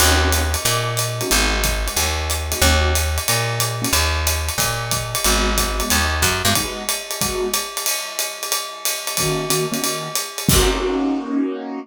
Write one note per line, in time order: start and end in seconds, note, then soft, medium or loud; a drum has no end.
0.00 0.56 D#2 medium
0.00 0.15 A#3 medium
0.00 0.15 C#4 medium
0.00 0.15 D#4 medium
0.00 0.15 F#4 medium
0.00 crash medium
0.00 ride medium
0.24 0.43 A#3 medium
0.24 0.43 C#4 medium
0.24 0.43 D#4 medium
0.24 0.43 F#4 medium
0.32 hi-hat pedal medium
0.32 ride medium
0.54 ride medium
0.65 1.22 A#2 medium
0.65 ride medium
0.97 hi-hat pedal medium
0.97 ride medium
1.21 1.28 A#3 medium
1.21 1.28 C#4 medium
1.21 1.28 D#4 medium
1.21 1.28 F#4 medium
1.21 ride medium
1.30 1.89 G#1 medium
1.30 1.57 G#3 medium
1.30 1.57 B3 medium
1.30 1.57 D#4 medium
1.30 1.57 F#4 medium
1.30 ride medium
1.64 kick medium
1.64 hi-hat pedal medium
1.64 ride medium
1.87 2.06 G#3 medium
1.87 2.06 B3 medium
1.87 2.06 D#4 medium
1.87 2.06 F#4 medium
1.87 ride medium
1.97 2.54 D#2 medium
1.97 ride medium
2.30 hi-hat pedal medium
2.30 ride medium
2.52 2.59 G#3 medium
2.52 2.59 B3 medium
2.52 2.59 D#4 medium
2.52 2.59 F#4 medium
2.52 ride medium
2.62 3.19 D#2 medium
2.62 2.90 A#3 medium
2.62 2.90 C#4 loud
2.62 2.90 D#4 medium
2.62 2.90 F#4 medium
2.62 kick soft
2.62 ride medium
2.95 hi-hat pedal medium
2.95 ride medium
3.18 ride medium
3.28 3.86 A#2 medium
3.28 ride medium
3.60 hi-hat pedal medium
3.60 ride medium
3.82 3.89 A#3 medium
3.82 3.89 C#4 medium
3.82 3.89 D#4 medium
3.82 3.89 F#4 medium
3.82 ride medium
3.93 4.50 D#2 medium
3.93 ride medium
4.27 hi-hat pedal medium
4.27 ride medium
4.49 ride medium
4.58 5.15 A#2 medium
4.58 kick medium
4.58 ride medium
4.91 kick soft
4.91 hi-hat pedal medium
4.91 ride medium
5.15 ride medium
5.24 5.82 G#1 medium
5.24 5.52 G#3 medium
5.24 5.52 B3 medium
5.24 5.52 D#4 medium
5.24 5.52 F#4 medium
5.24 ride medium
5.57 5.75 G#3 medium
5.57 5.75 B3 medium
5.57 5.75 D#4 medium
5.57 5.75 F#4 medium
5.57 kick soft
5.57 hi-hat pedal medium
5.57 ride medium
5.79 5.98 G#3 medium
5.79 5.98 B3 medium
5.79 5.98 D#4 medium
5.79 5.98 F#4 medium
5.79 ride medium
5.90 6.23 D#2 medium
5.90 ride medium
6.22 6.43 F#2 medium
6.22 kick soft
6.22 hi-hat pedal medium
6.22 ride medium
6.45 6.54 G2 medium
6.45 6.53 G#3 medium
6.45 6.53 B3 medium
6.45 6.53 D#4 medium
6.45 6.53 F#4 medium
6.45 ride medium
6.55 6.83 G#3 loud
6.55 6.83 B3 medium
6.55 6.83 D#4 medium
6.55 6.83 F#4 loud
6.55 kick soft
6.55 ride medium
6.89 hi-hat pedal medium
6.89 ride medium
7.11 ride medium
7.21 7.48 G#3 medium
7.21 7.48 B3 medium
7.21 7.48 D#4 medium
7.21 7.48 F#4 medium
7.21 kick medium
7.21 ride medium
7.53 hi-hat pedal medium
7.53 ride medium
7.77 ride medium
7.86 ride loud
8.19 hi-hat pedal medium
8.19 ride medium
8.43 ride medium
8.52 ride medium
8.85 hi-hat pedal medium
8.85 ride medium
9.07 ride medium
9.17 9.46 D#3 medium
9.17 9.46 A#3 medium
9.17 9.46 C#4 medium
9.17 9.46 F#4 medium
9.17 kick soft
9.17 ride medium
9.50 9.66 D#3 medium
9.50 9.66 A#3 medium
9.50 9.66 C#4 medium
9.50 9.66 F#4 medium
9.50 hi-hat pedal medium
9.50 ride medium
9.72 9.79 D#3 medium
9.72 9.79 A#3 medium
9.72 9.79 C#4 medium
9.72 9.79 F#4 medium
9.72 ride medium
9.82 10.08 D#3 medium
9.82 10.08 A#3 medium
9.82 10.08 C#4 medium
9.82 10.08 F#4 medium
9.82 ride medium
10.15 hi-hat pedal medium
10.15 ride medium
10.38 ride medium
10.49 11.79 A#3 loud
10.49 11.79 C#4 medium
10.49 11.79 D#4 loud
10.49 11.79 F#4 medium
10.49 kick loud
10.49 crash loud